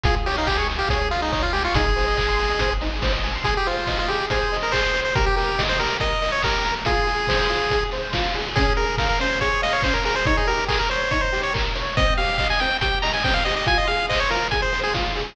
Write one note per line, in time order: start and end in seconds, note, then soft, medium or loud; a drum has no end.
0.03 0.84 C#2 medium
0.03 0.14 F4 medium
0.03 0.15 G#4 medium
0.03 kick medium
0.03 closed hi-hat loud
0.15 0.25 G#4 medium
0.26 0.36 G4 medium
0.26 0.36 C#5 medium
0.26 open hi-hat medium
0.37 0.48 D#4 medium
0.37 0.47 F5 medium
0.47 0.57 G4 medium
0.47 0.57 G#5 medium
0.47 kick medium
0.47 clap medium
0.57 0.68 G#4 medium
0.57 0.68 C#6 medium
0.69 0.78 G#5 medium
0.69 open hi-hat medium
0.79 0.89 G4 medium
0.79 0.89 F5 medium
0.89 1.68 C#2 medium
0.89 1.09 G#4 medium
0.89 0.99 C#5 medium
0.89 kick medium
0.89 closed hi-hat loud
1.01 1.11 G#4 medium
1.11 1.20 F4 medium
1.11 1.21 F4 medium
1.11 open hi-hat medium
1.22 1.32 D#4 medium
1.22 1.32 G#4 medium
1.32 1.43 D#4 medium
1.32 1.42 C#5 medium
1.32 kick medium
1.32 clap medium
1.42 1.53 F4 medium
1.42 1.53 F5 medium
1.53 1.63 G4 medium
1.53 1.63 G#5 medium
1.53 open hi-hat medium
1.64 1.75 F4 medium
1.64 1.74 C#6 medium
1.74 2.53 G#1 loud
1.74 1.85 D#4 medium
1.74 2.73 G#4 medium
1.74 kick loud
1.74 closed hi-hat loud
1.86 1.95 G#4 medium
1.96 2.05 C5 medium
1.96 open hi-hat medium
2.08 2.17 D#5 medium
2.17 2.27 G#5 medium
2.17 kick medium
2.17 clap medium
2.28 2.38 C6 medium
2.39 2.49 G#5 medium
2.39 open hi-hat medium
2.50 2.59 D#5 medium
2.59 3.39 G#1 medium
2.59 2.70 C5 medium
2.59 kick medium
2.59 closed hi-hat loud
2.71 2.81 G#4 medium
2.81 2.91 D#4 medium
2.81 open hi-hat medium
2.93 3.02 G#4 medium
3.02 3.12 C5 medium
3.02 kick medium
3.02 snare loud
3.13 3.23 D#5 medium
3.24 3.33 G#5 medium
3.24 open hi-hat medium
3.35 3.45 C6 medium
3.44 3.54 G#4 medium
3.44 3.64 G#4 medium
3.44 kick medium
3.44 closed hi-hat medium
3.57 3.67 G4 medium
3.66 3.98 F4 medium
3.66 3.86 C5 medium
3.66 open hi-hat medium
3.87 4.07 D#5 medium
3.87 kick medium
3.87 snare medium
3.99 4.09 F4 medium
4.08 4.26 G4 medium
4.08 4.29 G#4 medium
4.08 open hi-hat medium
4.30 4.57 G#4 medium
4.30 4.50 C5 medium
4.30 kick medium
4.30 closed hi-hat loud
4.52 4.71 D#5 medium
4.52 open hi-hat medium
4.63 4.73 A#4 medium
4.72 4.92 G#4 medium
4.72 5.01 C5 medium
4.72 kick medium
4.72 clap loud
4.94 5.13 C5 medium
4.94 open hi-hat medium
5.05 5.15 C5 medium
5.15 5.34 G4 medium
5.15 5.26 A#4 medium
5.15 kick loud
5.15 closed hi-hat loud
5.26 5.36 G4 medium
5.36 5.63 G4 medium
5.36 5.56 A#4 medium
5.36 open hi-hat medium
5.58 5.77 D#5 medium
5.58 kick medium
5.58 snare loud
5.69 5.79 C5 medium
5.79 5.98 G4 medium
5.79 5.97 A#4 medium
5.79 open hi-hat medium
6.00 6.19 A#4 medium
6.00 6.31 D#5 medium
6.00 kick medium
6.00 closed hi-hat medium
6.22 6.41 D#5 medium
6.22 open hi-hat medium
6.32 6.42 C#5 medium
6.42 6.63 G4 medium
6.42 6.75 A#4 medium
6.42 kick medium
6.42 clap loud
6.64 6.84 A#4 medium
6.64 open hi-hat medium
6.85 7.05 F4 medium
6.85 7.84 G#4 medium
6.85 kick medium
6.85 closed hi-hat loud
7.07 7.26 G#4 medium
7.07 open hi-hat medium
7.27 7.47 C5 medium
7.27 kick medium
7.27 snare loud
7.49 7.69 F4 medium
7.49 open hi-hat medium
7.70 7.90 G#4 medium
7.70 kick medium
7.70 closed hi-hat medium
7.91 8.12 C5 medium
7.91 open hi-hat medium
8.13 8.33 F4 medium
8.13 kick medium
8.13 snare loud
8.34 8.54 G#4 medium
8.34 open hi-hat medium
8.55 8.75 C#4 medium
8.55 8.73 G#4 medium
8.55 kick loud
8.55 closed hi-hat loud
8.76 8.97 G#4 medium
8.76 8.96 A#4 medium
8.76 open hi-hat medium
8.98 9.08 A#4 medium
8.98 9.18 F5 medium
8.98 kick medium
8.98 snare medium
9.09 9.19 A#4 medium
9.20 9.39 C#4 medium
9.20 9.39 C5 medium
9.20 open hi-hat medium
9.41 9.60 G#4 medium
9.41 9.62 C#5 medium
9.41 kick medium
9.41 closed hi-hat medium
9.62 9.73 D#5 medium
9.62 9.81 F5 medium
9.62 open hi-hat medium
9.73 9.83 C#5 medium
9.82 10.03 C#4 medium
9.82 9.94 C5 medium
9.82 kick medium
9.82 clap loud
9.94 10.04 A#4 medium
10.04 10.23 G#4 medium
10.04 10.15 A#4 medium
10.04 open hi-hat medium
10.16 10.26 C5 medium
10.25 10.46 D#4 loud
10.25 10.37 C#5 medium
10.25 kick loud
10.25 closed hi-hat medium
10.37 10.47 G#4 medium
10.47 10.67 G4 medium
10.47 10.65 A#4 medium
10.47 open hi-hat medium
10.68 10.78 G#4 medium
10.68 10.88 A#4 medium
10.68 kick medium
10.68 clap loud
10.79 10.89 A#4 medium
10.89 11.11 C5 medium
10.89 11.08 C#5 medium
10.89 open hi-hat medium
11.11 11.30 D#4 medium
11.11 11.21 C#5 medium
11.11 kick medium
11.11 closed hi-hat medium
11.21 11.41 C5 medium
11.32 11.51 G4 medium
11.32 open hi-hat medium
11.43 11.53 C#5 medium
11.54 11.73 A#4 medium
11.54 kick medium
11.54 clap loud
11.75 11.94 C#5 medium
11.75 open hi-hat medium
11.97 12.16 C4 medium
11.97 12.14 D#5 medium
11.97 kick loud
11.97 closed hi-hat loud
12.17 12.37 G4 medium
12.17 12.37 F5 medium
12.17 open hi-hat medium
12.38 12.58 D#5 medium
12.38 12.48 F5 medium
12.38 kick medium
12.38 clap medium
12.50 12.60 G#5 medium
12.59 12.80 C4 medium
12.59 12.77 G5 medium
12.59 open hi-hat medium
12.81 13.01 G4 medium
12.81 12.99 G5 medium
12.81 kick medium
12.81 closed hi-hat loud
13.02 13.22 D#5 medium
13.02 13.12 A#5 medium
13.02 open hi-hat medium
13.13 13.23 G#5 medium
13.24 13.43 C4 medium
13.24 13.34 G5 medium
13.24 kick medium
13.24 snare medium
13.34 13.44 F5 medium
13.45 13.65 G4 medium
13.45 13.55 D#5 medium
13.45 open hi-hat medium
13.56 13.67 D#5 medium
13.66 13.86 F4 loud
13.66 13.78 G#5 loud
13.66 kick medium
13.66 closed hi-hat medium
13.78 13.88 D#5 medium
13.87 14.07 G#4 medium
13.87 14.06 F5 medium
13.87 open hi-hat medium
14.09 14.28 C5 medium
14.09 14.20 D#5 medium
14.09 kick medium
14.09 clap loud
14.20 14.30 C#5 medium
14.30 14.49 F4 medium
14.30 14.48 A#4 medium
14.30 open hi-hat medium
14.51 14.70 G#4 medium
14.51 14.61 G#5 medium
14.51 kick medium
14.51 closed hi-hat medium
14.62 14.80 C5 medium
14.73 14.92 C5 medium
14.73 open hi-hat medium
14.84 14.94 G#4 medium
14.94 15.13 F4 medium
14.94 kick medium
14.94 snare loud
15.15 15.34 G#4 medium
15.15 open hi-hat medium